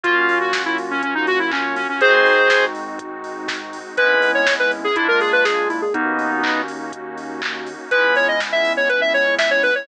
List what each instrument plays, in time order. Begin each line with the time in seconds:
0.03 synth bass 1 F#2, electric piano 2 A#3 C#4 F4 F#4, pad 5 (bowed) A#3 C#4 F4 F#4, lead 1 (square) F4, kick, closed hi-hat
0.29 open hi-hat
0.41 lead 1 (square) F#4
0.53 kick, snare
0.66 lead 1 (square) E4
0.78 open hi-hat
0.91 lead 1 (square) C#4
1.02 lead 1 (square) C#4, kick, closed hi-hat
1.15 lead 1 (square) D#4
1.27 lead 1 (square) F#4, open hi-hat
1.39 lead 1 (square) E4
1.51 lead 1 (square) C#4, kick, clap
1.76 lead 1 (square) C#4, open hi-hat
1.89 lead 1 (square) C#4
2.01 synth bass 1 G#1, electric piano 2 G#3 C4 D#4 F#4, pad 5 (bowed) G#3 C4 D#4 F#4, lead 1 (square) G#4 C5, kick, closed hi-hat
2.26 open hi-hat
2.50 kick, snare
2.75 open hi-hat
2.99 kick, closed hi-hat
3.24 open hi-hat
3.48 kick, snare
3.73 open hi-hat
3.97 synth bass 1 G#1, pad 5 (bowed) G#3 B3 C#4 E4, electric piano 2 G#3 B3 C#4 E4, lead 1 (square) B4, kick, closed hi-hat
4.22 open hi-hat
4.35 lead 1 (square) C#5
4.47 kick, snare
4.59 lead 1 (square) B4
4.71 open hi-hat
4.84 lead 1 (square) G#4
4.96 synth bass 1 A#1, pad 5 (bowed) G#3 A#3 D4 F4, electric piano 2 G#3 A#3 D4 F4, lead 1 (square) E4, kick, closed hi-hat
5.08 lead 1 (square) A#4
5.20 lead 1 (square) G#4, open hi-hat
5.33 lead 1 (square) B4
5.45 lead 1 (square) G#4, kick, snare
5.69 lead 1 (square) E4, open hi-hat
5.82 lead 1 (square) G#4
5.94 synth bass 1 D#2, electric piano 2 A#3 C#4 D#4 F#4, pad 5 (bowed) A#3 C#4 D#4 F#4, lead 1 (square) B3 D#4, kick, closed hi-hat
6.19 open hi-hat
6.43 kick, clap
6.68 open hi-hat
6.93 kick, closed hi-hat
7.18 open hi-hat
7.42 kick, clap
7.66 open hi-hat
7.91 synth bass 1 C#2, pad 5 (bowed) G#3 B3 C#4 E4, electric piano 2 G#3 B3 C#4 E4, lead 1 (square) B4, kick, closed hi-hat
8.15 lead 1 (square) C#5, open hi-hat
8.28 lead 1 (square) D#5
8.40 kick, snare
8.52 lead 1 (square) E5
8.65 open hi-hat
8.77 lead 1 (square) C#5
8.89 lead 1 (square) B4, kick, closed hi-hat
9.01 lead 1 (square) E5
9.14 lead 1 (square) C#5, open hi-hat
9.39 lead 1 (square) E5, kick, snare
9.51 lead 1 (square) C#5
9.63 lead 1 (square) B4, open hi-hat
9.75 lead 1 (square) C#5